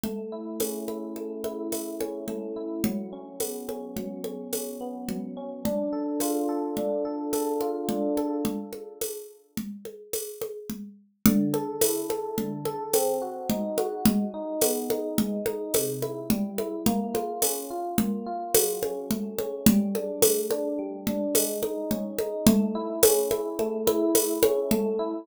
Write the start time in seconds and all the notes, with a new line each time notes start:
0.04 A3, low conga
0.32 E4
0.60 C#4, tambourine, high conga
0.88 E4, high conga
1.16 A3, high conga
1.44 E4, high conga
1.72 E4, tambourine, high conga
2.00 C#4, high conga
2.28 A3, low conga
2.56 E4
2.84 F#3, low conga
3.13 C#4
3.40 B3, tambourine, high conga
3.68 C#4, high conga
3.96 F#3, low conga
4.24 C#4, high conga
4.53 C#4, tambourine, high conga
4.81 B3
5.09 F#3, low conga
5.37 C#4
5.65 D4, low conga
5.93 A4
6.20 F4, tambourine, high conga
6.49 A4
6.77 D4, low conga
7.05 A4
7.33 A4, tambourine, high conga
7.61 F4, high conga
7.89 D4, low conga
8.17 A4, high conga
8.45 low conga
8.73 high conga
9.01 tambourine, high conga
9.57 low conga
9.85 high conga
10.13 tambourine, high conga
10.41 high conga
10.70 low conga
11.26 D3, low conga
11.54 A4, high conga
11.81 E4, tambourine, high conga
12.10 A4, high conga
12.38 D3, low conga
12.65 A4, high conga
12.93 C4, tambourine, high conga
13.22 F#4
13.50 D#4, low conga
13.78 F#4, high conga
14.05 G#3, low conga
14.34 D#4
14.61 B3, tambourine, high conga
14.90 D#4, high conga
15.18 G#3, low conga
15.46 D#4, high conga
15.74 C3, tambourine, high conga
16.02 E4, high conga
16.30 G3, low conga
16.58 E4, high conga
16.86 A#3, low conga
17.14 F4, high conga
17.42 C#4, tambourine, high conga
17.70 F4
17.98 A#3, low conga
18.26 F4
18.54 F#3, tambourine, high conga
18.82 C#4, high conga
19.11 A3, low conga
19.39 C#4, high conga
19.66 G3, low conga
19.95 D4, high conga
20.22 A3, tambourine, high conga
20.51 D4, high conga
20.79 G3
21.07 D4, low conga
21.35 G#3, tambourine, high conga
21.63 D#4, high conga
21.91 C#4, low conga
22.19 D#4, high conga
22.47 A3, low conga
22.75 E4
23.03 C#4, tambourine, high conga
23.31 E4, high conga
23.59 A3, high conga
23.87 E4, high conga
24.15 E4, tambourine, high conga
24.43 C#4, high conga
24.71 A3, low conga
24.99 E4